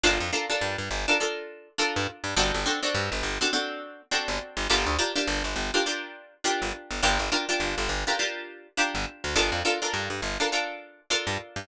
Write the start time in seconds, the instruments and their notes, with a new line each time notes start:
0.04 electric bass (finger) G1, pizzicato strings D4 F4 A4 A#4
0.20 electric bass (finger) F2
0.33 pizzicato strings D4 F4 A4 A#4
0.50 pizzicato strings D4 F4 A4 A#4
0.61 electric bass (finger) G2
0.78 electric bass (finger) G2
0.91 electric bass (finger) G1
1.08 pizzicato strings D4 F4 A4 A#4
1.20 pizzicato strings D4 F4 A4 A#4
1.78 pizzicato strings D4 F4 A4 A#4
1.96 electric bass (finger) G2
2.24 electric bass (finger) G2
2.36 electric bass (finger) G1, pizzicato strings C4 D4 F#4 A4
2.54 electric bass (finger) G1
2.66 pizzicato strings C4 D4 F#4 A4
2.83 pizzicato strings C4 D4 F#4 A4
2.95 electric bass (finger) G2
3.12 electric bass (finger) G1
3.23 electric bass (finger) G1
3.41 pizzicato strings C4 D4 F#4 A4
3.53 pizzicato strings C4 D4 F#4 A4
4.11 pizzicato strings C4 D4 F#4 A4
4.28 electric bass (finger) G1
4.57 electric bass (finger) G1
4.70 electric bass (finger) G1, pizzicato strings D4 F4 G4 A#4
4.86 electric bass (finger) D2
4.99 pizzicato strings D4 F4 G4 A#4
5.16 pizzicato strings D4 F4 G4 A#4
5.27 electric bass (finger) G1
5.44 electric bass (finger) G1
5.56 electric bass (finger) G1
5.74 pizzicato strings D4 F4 G4 A#4
5.86 pizzicato strings D4 F4 G4 A#4
6.44 pizzicato strings D4 F4 G4 A#4
6.62 electric bass (finger) G1
6.91 electric bass (finger) G1
7.03 electric bass (finger) G1, pizzicato strings D4 F4 G4 A#4
7.19 electric bass (finger) G1
7.32 pizzicato strings D4 F4 G4 A#4
7.49 pizzicato strings D4 F4 G4 A#4
7.60 electric bass (finger) G1
7.78 electric bass (finger) G1
7.89 electric bass (finger) G1
8.07 pizzicato strings D4 F4 G4 A#4
8.19 pizzicato strings D4 F4 G4 A#4
8.77 pizzicato strings D4 F4 G4 A#4
8.95 electric bass (finger) G1
9.24 electric bass (finger) D2
9.36 electric bass (finger) G1, pizzicato strings D4 F4 A4 A#4
9.52 electric bass (finger) F2
9.65 pizzicato strings D4 F4 A4 A#4
9.82 pizzicato strings D4 F4 A4 A#4
9.94 electric bass (finger) G2
10.10 electric bass (finger) G2
10.22 electric bass (finger) G1
10.40 pizzicato strings D4 F4 A4 A#4
10.52 pizzicato strings D4 F4 A4 A#4
11.10 pizzicato strings D4 F4 A4 A#4
11.27 electric bass (finger) G2
11.56 electric bass (finger) G2